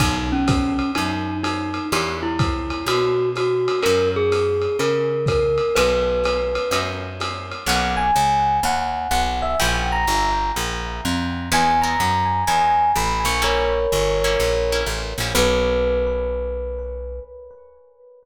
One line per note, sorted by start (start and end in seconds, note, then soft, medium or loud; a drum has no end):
0.00 0.81 B1 medium
0.00 0.36 A#3 loud
0.00 0.36 B3 loud
0.00 0.36 D#4 loud
0.00 0.29 D#4 medium
0.00 0.36 F#4 loud
0.00 kick medium
0.00 ride loud
0.32 0.91 C#4 medium
0.48 kick medium
0.48 hi-hat pedal loud
0.48 ride medium
0.79 ride medium
0.95 1.80 F#2 medium
0.95 1.37 D#4 medium
0.95 ride loud
1.43 1.85 D#4 medium
1.43 hi-hat pedal medium
1.43 ride medium
1.74 ride medium
1.92 2.74 E2 medium
1.92 2.30 D4 loud
1.92 2.30 E4 loud
1.92 2.30 F#4 medium
1.92 2.30 G4 medium
1.92 2.17 G4 medium
1.92 ride loud
2.23 2.85 E4 medium
2.39 kick medium
2.39 hi-hat pedal medium
2.39 ride medium
2.70 ride medium
2.86 3.68 B2 medium
2.86 3.29 F#4 medium
2.86 ride loud
3.35 3.80 F#4 medium
3.35 hi-hat pedal medium
3.35 ride medium
3.68 ride medium
3.83 4.68 F#2 medium
3.83 4.20 C#4 loud
3.83 4.20 E4 loud
3.83 4.20 F#4 loud
3.83 4.20 A#4 loud
3.83 4.08 A#4 medium
3.83 ride medium
4.16 4.77 G#4 medium
4.32 hi-hat pedal medium
4.32 ride medium
4.62 ride medium
4.79 5.61 C#3 medium
4.79 5.24 A#4 medium
4.79 ride medium
5.26 5.76 A#4 medium
5.26 kick medium
5.26 hi-hat pedal medium
5.26 ride medium
5.58 ride medium
5.75 6.58 B1 medium
5.75 6.14 D#4 loud
5.75 6.14 F#4 loud
5.75 6.14 A#4 medium
5.75 6.78 B4 loud
5.75 6.14 B4 loud
5.75 ride loud
6.24 hi-hat pedal medium
6.24 ride loud
6.55 ride medium
6.71 7.53 F#2 medium
6.71 7.11 D#4 medium
6.71 7.11 F#4 medium
6.71 7.11 A#4 medium
6.71 7.11 B4 medium
6.71 ride loud
7.20 hi-hat pedal medium
7.20 ride loud
7.51 ride medium
7.66 8.11 B1 medium
7.66 8.06 A#3 loud
7.66 8.06 B3 loud
7.66 8.06 C#4 loud
7.66 8.06 D#4 loud
7.66 7.92 F#5 loud
7.97 8.57 G#5 medium
8.16 8.60 C#2 medium
8.63 9.08 D#2 medium
8.63 9.11 F#5 medium
9.11 9.55 B1 medium
9.11 9.40 F#5 medium
9.42 9.57 E5 medium
9.60 10.06 A#1 medium
9.60 9.97 G3 loud
9.60 9.97 A#3 loud
9.60 9.97 C#4 loud
9.60 9.97 E4 loud
9.60 9.85 G5 medium
9.92 10.50 A#5 medium
10.07 10.52 G1 medium
10.56 11.01 A#1 medium
11.05 11.49 F2 medium
11.52 11.96 E2 loud
11.52 11.73 G#3 loud
11.52 11.73 B3 loud
11.52 11.73 D#4 loud
11.52 11.73 E4 loud
11.52 11.80 G#5 loud
11.82 12.13 G#3 medium
11.82 12.13 B3 loud
11.82 12.13 D#4 loud
11.82 12.13 E4 loud
11.82 12.42 A#5 medium
12.00 12.44 F#2 medium
12.47 12.92 E2 medium
12.47 12.85 G#3 medium
12.47 12.85 B3 medium
12.47 12.85 D#4 medium
12.47 12.85 E4 loud
12.47 12.90 G#5 medium
12.96 13.25 A1 medium
12.96 13.27 B5 medium
13.25 13.87 A#1 medium
13.25 13.41 C#6 medium
13.42 13.79 G3 loud
13.42 13.79 A#3 loud
13.42 13.79 C#4 medium
13.42 13.79 E4 loud
13.42 14.80 A#4 medium
13.42 14.80 C#5 loud
13.92 14.37 G1 medium
14.24 14.54 G3 loud
14.24 14.54 A#3 loud
14.24 14.54 C#4 loud
14.24 14.54 E4 loud
14.40 14.84 A#1 medium
14.72 15.02 G3 medium
14.72 15.02 A#3 loud
14.72 15.02 C#4 medium
14.72 15.02 E4 loud
14.86 15.14 A1 medium
15.18 15.33 A#1 medium
15.18 15.33 G3 medium
15.18 15.33 A#3 medium
15.18 15.33 C#4 loud
15.18 15.33 E4 medium
15.35 17.20 B1 loud
15.35 17.21 A#3 loud
15.35 17.21 B3 loud
15.35 17.21 C#4 loud
15.35 17.21 D#4 loud
15.35 17.20 B4 loud